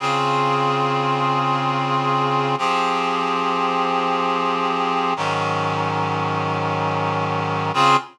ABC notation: X:1
M:4/4
L:1/8
Q:1/4=93
K:Db
V:1 name="Clarinet"
[D,CFA]8 | [F,C=GA]8 | [A,,E,G,D]8 | [D,CFA]2 z6 |]